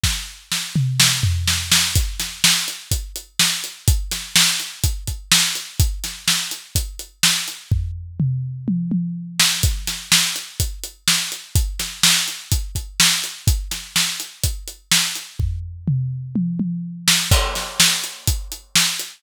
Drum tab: CC |--------|--------|--------|--------|
HH |--------|xx-xxx-x|xx-xxx-x|xx-xxx-x|
SD |o-o-o-oo|-oo---o-|-oo---o-|-oo---o-|
T1 |--------|--------|--------|--------|
T2 |---o----|--------|--------|--------|
FT |-----o--|--------|--------|--------|
BD |o-------|o---o---|o---oo--|o---o---|

CC |--------|--------|--------|--------|
HH |--------|xx-xxx-x|xx-xxx-x|xx-xxx-x|
SD |-------o|-oo---o-|-oo---o-|-oo---o-|
T1 |----oo--|--------|--------|--------|
T2 |--o-----|--------|--------|--------|
FT |o-------|--------|--------|--------|
BD |o-------|o---o---|o---oo--|o---o---|

CC |--------|x-------|
HH |--------|-x-xxx-x|
SD |-------o|-oo---o-|
T1 |----oo--|--------|
T2 |--o-----|--------|
FT |o-------|--------|
BD |o-------|o---o---|